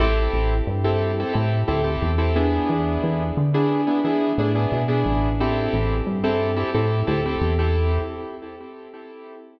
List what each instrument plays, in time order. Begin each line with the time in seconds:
0.00 synth bass 1 A1, acoustic grand piano C4 E4 G4 A4
0.34 synth bass 1 A1
0.67 synth bass 1 G2
0.84 acoustic grand piano C4 E4 G4 A4
1.20 acoustic grand piano C4 E4 G4 A4
1.33 synth bass 1 A2, acoustic grand piano C4 E4 G4 A4
1.68 synth bass 1 D2, acoustic grand piano C4 E4 G4 A4
1.84 acoustic grand piano C4 E4 G4 A4
2.02 synth bass 1 E2
2.18 acoustic grand piano C4 E4 G4 A4
2.36 acoustic grand piano B3 D4 E4 G#4
2.70 synth bass 1 E2
3.04 synth bass 1 E2
3.37 synth bass 1 D3
3.54 acoustic grand piano B3 D4 E4 G#4
3.87 acoustic grand piano B3 D4 E4 G#4
4.04 synth bass 1 E3, acoustic grand piano B3 D4 E4 G#4
4.38 synth bass 1 A2, acoustic grand piano B3 D4 E4 G#4
4.55 acoustic grand piano B3 D4 E4 G#4
4.72 synth bass 1 B2
4.88 acoustic grand piano B3 D4 E4 G#4
5.06 synth bass 1 A1
5.40 acoustic grand piano C4 E4 G4 A4
5.73 synth bass 1 A1
6.07 synth bass 1 G2
6.24 acoustic grand piano C4 E4 G4 A4
6.56 acoustic grand piano C4 E4 G4 A4
6.74 synth bass 1 A2, acoustic grand piano C4 E4 G4 A4
7.07 synth bass 1 D2, acoustic grand piano C4 E4 G4 A4
7.26 acoustic grand piano C4 E4 G4 A4
7.41 synth bass 1 E2
7.59 acoustic grand piano C4 E4 G4 A4